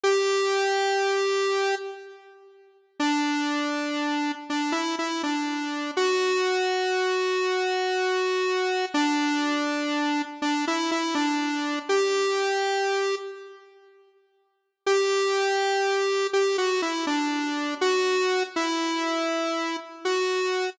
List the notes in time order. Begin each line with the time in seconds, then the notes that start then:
0.03 G4
3.00 D4
4.50 D4
4.72 E4
4.99 E4
5.23 D4
5.97 F#4
8.94 D4
10.42 D4
10.67 E4
10.91 E4
11.15 D4
11.89 G4
14.86 G4
16.33 G4
16.58 F#4
16.82 E4
17.07 D4
17.81 F#4
18.56 E4
20.05 F#4